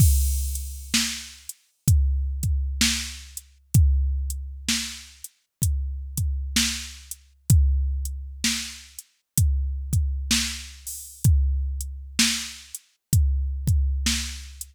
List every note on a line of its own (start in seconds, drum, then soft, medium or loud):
0.00 kick loud
0.00 crash medium
0.55 closed hi-hat medium
0.94 snare loud
1.49 closed hi-hat medium
1.88 kick medium
1.88 closed hi-hat loud
2.43 kick medium
2.43 closed hi-hat medium
2.81 snare loud
3.37 closed hi-hat medium
3.74 kick loud
3.74 closed hi-hat medium
4.30 closed hi-hat medium
4.69 snare medium
5.24 closed hi-hat medium
5.62 kick medium
5.62 closed hi-hat loud
6.17 kick medium
6.17 closed hi-hat medium
6.56 snare loud
7.11 closed hi-hat medium
7.50 kick loud
7.50 closed hi-hat loud
8.05 closed hi-hat medium
8.44 snare loud
8.99 closed hi-hat medium
9.38 kick medium
9.38 closed hi-hat loud
9.93 kick medium
9.93 closed hi-hat medium
10.31 snare loud
10.87 open hi-hat medium
11.24 kick loud
11.24 closed hi-hat medium
11.81 closed hi-hat medium
12.19 snare loud
12.75 closed hi-hat medium
13.13 kick medium
13.13 closed hi-hat loud
13.67 kick medium
13.67 closed hi-hat medium
14.06 snare medium
14.61 closed hi-hat medium